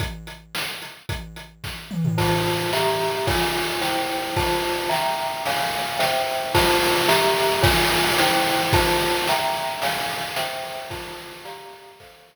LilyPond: <<
  \new Staff \with { instrumentName = "Glockenspiel" } { \time 2/2 \key f \major \tempo 2 = 110 r1 | r1 | <f' c'' a''>2 <g' e'' bes''>2 | <f' des'' aes''>2 <e' c'' g''>2 |
<f' c'' a''>2 <e'' g'' bes''>2 | <des'' f'' aes''>2 <c'' e'' g''>2 | <f' c'' a''>2 <g' e'' bes''>2 | <f' des'' aes''>2 <e' c'' g''>2 |
<f' c'' a''>2 <e'' g'' bes''>2 | <des'' f'' aes''>2 <c'' e'' g''>2 | <f' c'' a''>2 <g' d'' f'' bes''>2 | <a' c'' f''>2 r2 | }
  \new DrumStaff \with { instrumentName = "Drums" } \drummode { \time 2/2 <hh bd>4 hh4 sn4 hh4 | <hh bd>4 hh4 <bd sn>4 toml8 tomfh8 | <cymc bd>4 cymr4 sn4 cymr4 | <bd cymr>4 cymr4 sn4 cymr4 |
<bd cymr>4 cymr4 sn4 cymr4 | cymr4 cymr4 sn4 cymr4 | <cymc bd>4 cymr4 sn4 cymr4 | <bd cymr>4 cymr4 sn4 cymr4 |
<bd cymr>4 cymr4 sn4 cymr4 | cymr4 cymr4 sn4 cymr4 | <cymc bd>4 cymr4 sn4 cymr4 | <bd cymr>4 cymr4 r2 | }
>>